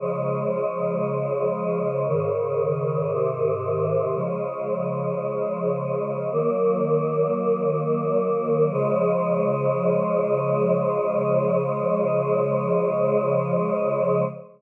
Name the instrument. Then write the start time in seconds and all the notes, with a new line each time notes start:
choir aahs
0.00 C#3 F3 G#3
2.07 G#2 C#3 D#3
3.12 G#2 C3 D#3
4.14 C#3 F3 G#3
6.32 D#3 F#3 A#3
8.72 C#3 F3 G#3